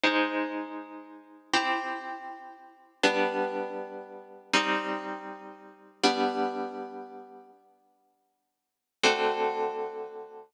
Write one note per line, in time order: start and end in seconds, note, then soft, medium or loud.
0.04 1.51 G#3 medium
0.04 1.51 D#4 medium
0.04 1.51 C5 medium
1.54 3.01 C4 medium
1.54 3.01 E4 medium
1.54 3.01 G4 medium
3.03 4.50 G3 medium
3.03 4.50 B3 medium
3.03 4.50 D4 medium
4.54 6.01 G3 medium
4.54 6.01 C4 medium
4.54 6.01 D#4 medium
6.04 7.51 G3 medium
6.04 7.51 B3 medium
6.04 7.51 D4 medium
9.03 10.51 D3 medium
9.03 10.51 A3 medium
9.03 10.51 C4 medium
9.03 10.51 F#4 medium